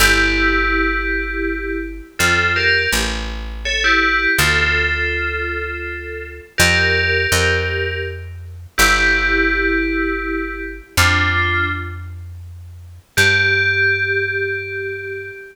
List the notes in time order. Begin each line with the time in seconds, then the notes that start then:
0.00 G1 E4 G4
2.19 F2 F4 A4
2.56 G4 A#4
2.92 A1
3.65 A4 C#5
3.84 E4 G4
4.38 D2 F4 A4
6.58 F2 G4 A#4
7.32 F2
8.78 G1 E4 G4
10.97 F2 D4 F4
13.17 G2 G4